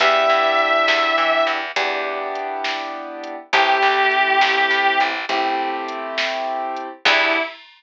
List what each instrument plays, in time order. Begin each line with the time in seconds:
0.00 electric bass (finger) E2, acoustic grand piano B3 D4 E4 G4, distortion guitar E5, kick, closed hi-hat
0.29 electric bass (finger) G2
0.59 closed hi-hat
0.88 electric bass (finger) E2, snare
1.18 electric bass (finger) E3
1.47 electric bass (finger) E2, closed hi-hat
1.76 electric bass (finger) E2, acoustic grand piano B3 D4 E4 G4, kick, closed hi-hat
2.35 closed hi-hat
2.64 snare
3.24 closed hi-hat
3.53 electric bass (finger) A1, acoustic grand piano A3 C4 E4 G4, distortion guitar G4, kick, closed hi-hat
3.82 electric bass (finger) C2
4.11 closed hi-hat
4.41 electric bass (finger) A1, snare
4.71 electric bass (finger) A2
5.00 electric bass (finger) A1, closed hi-hat
5.29 electric bass (finger) A1, acoustic grand piano A3 C4 E4 G4, kick, closed hi-hat
5.88 closed hi-hat
6.18 snare
6.76 closed hi-hat
7.05 electric bass (finger) E2, acoustic grand piano B3 D4 E4 G4, distortion guitar E4, kick, crash